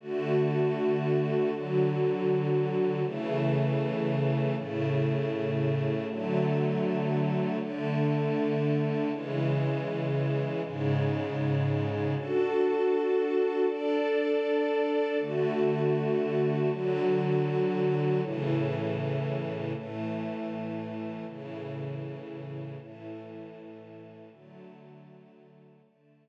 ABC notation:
X:1
M:12/8
L:1/8
Q:3/8=79
K:Dlyd
V:1 name="String Ensemble 1"
[D,A,F]6 [D,F,F]6 | [C,E,A,]6 [A,,C,A,]6 | [D,F,A,]6 [D,A,D]6 | [C,E,G,]6 [G,,C,G,]6 |
[DFA]6 [DAd]6 | [D,A,F]6 [D,F,F]6 | [A,,C,E,]6 [A,,E,A,]6 | [A,,C,E,]6 [A,,E,A,]6 |
[D,F,A,]6 [D,A,D]6 |]